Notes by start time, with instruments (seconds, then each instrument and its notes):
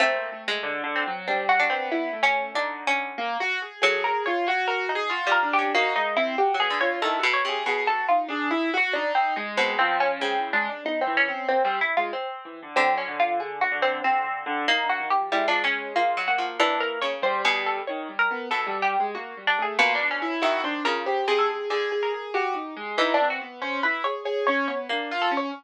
0.00 harpsichord A3 C4, acoustic grand piano A#3
0.32 acoustic grand piano A3
0.48 harpsichord G#3
0.63 acoustic grand piano D3
0.84 acoustic grand piano D3
0.96 harpsichord C4
1.07 acoustic grand piano F#3
1.28 acoustic grand piano G3, harpsichord C4 D4
1.49 harpsichord F#4
1.60 harpsichord D4
1.70 acoustic grand piano B3, harpsichord C4
1.92 harpsichord E4
2.13 acoustic grand piano A3
2.23 harpsichord C#4
2.54 acoustic grand piano D3, harpsichord D4 D#4
2.87 harpsichord C#4
3.18 acoustic grand piano A#3
3.40 acoustic grand piano F#4
3.62 acoustic grand piano G#4
3.82 harpsichord F#3 A4, acoustic grand piano G#4
4.04 acoustic grand piano G#4, harpsichord A#4
4.26 acoustic grand piano F4, harpsichord C#5
4.47 acoustic grand piano F#4, harpsichord C#5
4.68 harpsichord A#4
4.89 harpsichord D#4
4.95 acoustic grand piano G#4
5.09 acoustic grand piano F4, harpsichord F#4
5.27 harpsichord G3
5.32 harpsichord A#4
5.43 acoustic grand piano D4
5.53 harpsichord G4
5.59 harpsichord C#4
5.74 harpsichord A#3 F#4, acoustic grand piano D#4
5.96 acoustic grand piano G#3, harpsichord D#4
6.16 acoustic grand piano C4, harpsichord E4
6.38 acoustic grand piano F#4, harpsichord G4
6.54 harpsichord F#3
6.60 acoustic grand piano B3, harpsichord G#4
6.70 harpsichord D3
6.81 acoustic grand piano F4, harpsichord C#5
7.01 harpsichord D#3 A4, acoustic grand piano E4
7.19 acoustic grand piano F#4
7.23 harpsichord B2
7.34 harpsichord C#5
7.45 harpsichord C3, acoustic grand piano G#4
7.66 harpsichord B2 C#5, acoustic grand piano G#4
7.87 acoustic grand piano F#4, harpsichord A4
8.09 acoustic grand piano D#4, harpsichord F4
8.28 acoustic grand piano D4, harpsichord G#4
8.51 acoustic grand piano E4
8.74 acoustic grand piano F#4, harpsichord F#4
8.93 harpsichord D4, acoustic grand piano D#4
9.15 harpsichord C4
9.36 acoustic grand piano G#3, harpsichord D#4
9.57 harpsichord B2 C4
9.79 acoustic grand piano F3, harpsichord C4
10.00 harpsichord C#4
10.20 harpsichord C#3 C4, acoustic grand piano G#3
10.38 acoustic grand piano E3
10.53 acoustic grand piano G#3, harpsichord D4
10.69 acoustic grand piano D4
10.84 acoustic grand piano B3, harpsichord D#4
11.01 harpsichord C4
11.06 acoustic grand piano E3
11.17 harpsichord C#4
11.28 acoustic grand piano C4
11.48 acoustic grand piano A#3, harpsichord C4
11.64 acoustic grand piano G3, harpsichord C4
11.81 harpsichord E4
11.97 acoustic grand piano G#3, harpsichord F4
12.13 harpsichord C4
12.45 acoustic grand piano E3
12.62 acoustic grand piano D3
12.76 harpsichord D3 C4, acoustic grand piano F#3
12.97 harpsichord C#4
13.08 acoustic grand piano D3
13.20 harpsichord F4
13.40 harpsichord G#4
13.61 harpsichord F#4
13.72 acoustic grand piano D3
13.82 harpsichord C4
14.04 acoustic grand piano D3, harpsichord C4
14.24 acoustic grand piano D3
14.46 acoustic grand piano D3
14.68 harpsichord A#3 D#4
14.83 acoustic grand piano D3
14.89 harpsichord F#4
15.00 acoustic grand piano D#3
15.10 harpsichord G4
15.17 acoustic grand piano F3
15.32 harpsichord G3 E4, acoustic grand piano G#3
15.48 harpsichord F3 D4
15.64 harpsichord C#4
15.96 harpsichord A#3 F4
16.17 harpsichord F#3
16.27 acoustic grand piano A#3, harpsichord F#4
16.38 harpsichord F3
16.60 harpsichord E3 D4
16.80 harpsichord A#4
17.01 harpsichord C#3 C#5
17.22 acoustic grand piano G3, harpsichord C5
17.45 harpsichord B2 G#4
17.66 harpsichord A4
17.87 acoustic grand piano D#3, harpsichord C#5
18.09 acoustic grand piano G3
18.19 harpsichord A#4
18.31 acoustic grand piano B3
18.51 harpsichord B2 A4, acoustic grand piano E3
18.67 acoustic grand piano G3
18.82 harpsichord G4
19.00 acoustic grand piano G#3
19.15 acoustic grand piano A#3, harpsichord F#4
19.37 acoustic grand piano G3
19.47 harpsichord D4
19.58 acoustic grand piano A3
19.62 harpsichord G#4
19.79 harpsichord B2 F4, acoustic grand piano A#3
19.95 harpsichord D4
20.01 acoustic grand piano D4
20.11 harpsichord C#4
20.22 acoustic grand piano E4
20.41 harpsichord D#3 E4, acoustic grand piano F#4
20.64 acoustic grand piano D4, harpsichord C5
20.84 harpsichord C#3 A#4, acoustic grand piano F4
21.06 acoustic grand piano G4, harpsichord C5
21.28 harpsichord C3, acoustic grand piano G#4
21.39 harpsichord A4
21.49 acoustic grand piano G#4
21.70 harpsichord D3, acoustic grand piano G#4
21.92 acoustic grand piano G#4
22.03 harpsichord A#4
22.14 acoustic grand piano G#4
22.34 acoustic grand piano F#4, harpsichord G4
22.54 acoustic grand piano D#4
22.76 acoustic grand piano G#3
22.97 harpsichord E3 D#4, acoustic grand piano E4
23.14 harpsichord D4
23.20 acoustic grand piano C4
23.30 harpsichord F#4
23.41 acoustic grand piano B3
23.61 acoustic grand piano C#4, harpsichord C5
23.83 acoustic grand piano E4, harpsichord B4
24.04 acoustic grand piano G#4, harpsichord C#5
24.25 acoustic grand piano G#4, harpsichord C#5
24.47 acoustic grand piano C#4, harpsichord C#5
24.68 acoustic grand piano B3, harpsichord C#5
24.89 harpsichord A#3, acoustic grand piano D4
25.11 acoustic grand piano F4
25.22 harpsichord A4
25.31 acoustic grand piano C#4
25.37 harpsichord C#5